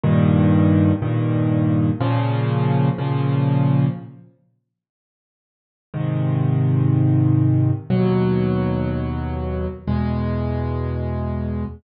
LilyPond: \new Staff { \clef bass \time 4/4 \key aes \major \tempo 4 = 122 <g, bes, ees>2 <g, bes, ees>2 | <bes, des f>2 <bes, des f>2 | r1 | <aes, c ees>1 |
<ees, ces ges>1 | <fes, ces aes>1 | }